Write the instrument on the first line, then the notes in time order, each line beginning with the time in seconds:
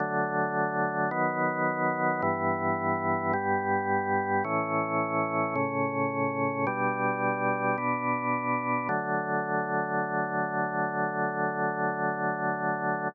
drawbar organ
0.00 D3 F#3 A3
1.11 D#3 F#3 B3
2.22 G2 E3 B3
3.33 G2 G3 B3
4.44 A2 E3 C#4
5.56 A2 C#3 C#4
6.67 B2 G3 D4
7.78 B2 B3 D4
8.89 D3 F#3 A3